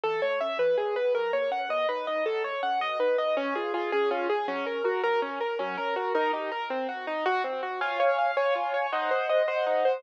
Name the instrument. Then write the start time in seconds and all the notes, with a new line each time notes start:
acoustic grand piano
0.04 E3 A4
0.22 A3 C#5
0.41 C#4 E5
0.58 E3 B4
0.78 G#3 G#4
0.96 B3 B4
1.15 F#3 A#4
1.33 A#3 C#5
1.51 C#4 F#5
1.69 B2 D#5
1.89 D#4 B4
2.07 D#4 D#5
2.26 F#3 A4
2.44 A3 C#5
2.63 C#4 F#5
2.80 B2 D#5
2.99 D#4 B4
3.18 D#4 D#5
3.37 C#4
3.55 F4 G#4
3.74 F4 G#4
3.92 C#4 G#4
4.10 C#4 F4
4.29 G#4
4.48 F#3 C#4
4.65 C#4 A#4
4.84 F#4 A#4
5.03 F#3 A#4
5.22 C#4
5.40 A#4
5.59 F#3 C#4
5.77 C#4 A#4
5.96 F#4 A#4
6.15 D#4 A#4
6.33 D#4 G4
6.52 A#4
6.70 C4
6.89 F#4
7.07 D#4
7.26 F#4
7.44 C4
7.63 F#4
7.81 F4 C#5 F5 G#5
8.00 C#5
8.18 F5
8.36 C#5 F5 G#5
8.55 F4
8.74 C#5
8.92 D#4 C5 D#5 F#5
9.11 C5
9.29 D#5
9.47 C5 D#5 F#5
9.67 D#4
9.85 C5